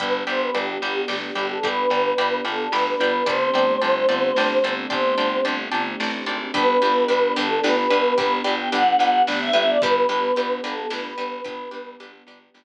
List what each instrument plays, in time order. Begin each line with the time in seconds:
0.00 electric bass (finger) G1, string ensemble 1 B3 D4 G4, choir aahs B4, orchestral harp D5 G5 B5, kick, closed hi-hat
0.27 electric bass (finger) G1, choir aahs C5, orchestral harp D5 G5 B5
0.42 choir aahs B4
0.55 electric bass (finger) G1, choir aahs G4, orchestral harp D5 G5 B5, closed hi-hat
0.82 electric bass (finger) G1, orchestral harp D5 G5 B5
1.08 electric bass (finger) G1, orchestral harp D5 G5 B5, snare
1.23 choir aahs G4
1.35 electric bass (finger) G1, orchestral harp D5 G5 B5
1.50 choir aahs A4
1.63 electric bass (finger) G1, choir aahs B4, orchestral harp D5 G5 B5, kick, closed hi-hat
1.90 electric bass (finger) G1, orchestral harp D5 G5 B5
2.18 electric bass (finger) G1, orchestral harp D5 G5 B5, closed hi-hat
2.45 electric bass (finger) G1, choir aahs A4, orchestral harp D5 G5 B5
2.72 electric bass (finger) G1, choir aahs B4, orchestral harp D5 G5 B5, snare
2.86 choir aahs B4
3.00 electric bass (finger) G1, orchestral harp D5 G5 B5
3.26 electric bass (finger) G1, string ensemble 1 A3 C4 D4 G4, choir aahs C5, orchestral harp D5 G5 A5 C6, kick, closed hi-hat
3.54 electric bass (finger) G1, orchestral harp D5 G5 A5 C6
3.82 electric bass (finger) G1, orchestral harp D5 G5 A5 C6, closed hi-hat
4.09 electric bass (finger) G1, orchestral harp D5 G5 A5 C6
4.36 electric bass (finger) G1, orchestral harp D5 G5 A5 C6, snare
4.64 electric bass (finger) G1, orchestral harp D5 G5 A5 C6
4.90 electric bass (finger) G1, choir aahs C5, orchestral harp D5 G5 A5 C6, kick, closed hi-hat
5.18 electric bass (finger) G1, orchestral harp D5 G5 A5 C6
5.45 electric bass (finger) G1, orchestral harp D5 G5 A5 C6, closed hi-hat
5.71 electric bass (finger) G1, orchestral harp D5 G5 A5 C6
6.00 electric bass (finger) A1, orchestral harp D5 G5 A5 C6, snare
6.26 electric bass (finger) G#1, orchestral harp D5 G5 A5 C6
6.54 electric bass (finger) G1, string ensemble 1 B3 D4 G4, orchestral harp D4 G4 B4, choir aahs B4, kick, closed hi-hat
6.82 electric bass (finger) G1, orchestral harp D4 G4 B4
7.08 electric bass (finger) G1, orchestral harp D4 G4 B4, closed hi-hat
7.36 electric bass (finger) G1, orchestral harp D4 G4 B4, choir aahs A4
7.63 electric bass (finger) G1, orchestral harp D4 G4 B4, choir aahs B4, snare
7.77 choir aahs B4
7.90 electric bass (finger) G1, orchestral harp D4 G4 B4
8.18 electric bass (finger) G1, orchestral harp D4 G4 B4, choir aahs B4, kick, closed hi-hat
8.44 electric bass (finger) G1, orchestral harp D4 G4 B4
8.59 choir aahs G5
8.72 electric bass (finger) G1, orchestral harp D4 G4 B4, choir aahs F#5, closed hi-hat
8.99 electric bass (finger) G1, orchestral harp D4 G4 B4
9.27 electric bass (finger) G1, orchestral harp D4 G4 B4, snare
9.40 choir aahs E5
9.53 electric bass (finger) G1, orchestral harp D4 G4 B4
9.68 choir aahs D5
9.82 electric bass (finger) G1, string ensemble 1 B3 D4 G4, orchestral harp D4 G4 B4, choir aahs B4, kick, closed hi-hat
10.09 electric bass (finger) G1, orchestral harp D4 G4 B4
10.36 electric bass (finger) G1, orchestral harp D4 G4 B4, closed hi-hat
10.64 electric bass (finger) G1, orchestral harp D4 G4 B4, choir aahs A4
10.90 electric bass (finger) G1, orchestral harp D4 G4 B4, choir aahs B4, snare
11.05 choir aahs B4
11.18 electric bass (finger) G1, orchestral harp D4 G4 B4
11.45 electric bass (finger) G1, orchestral harp D4 G4 B4, choir aahs B4, kick, closed hi-hat
11.71 electric bass (finger) G1, orchestral harp D4 G4 B4
12.00 electric bass (finger) G1, orchestral harp D4 G4 B4, closed hi-hat
12.27 electric bass (finger) G1, orchestral harp D4 G4 B4
12.54 electric bass (finger) G1, orchestral harp D4 G4 B4, snare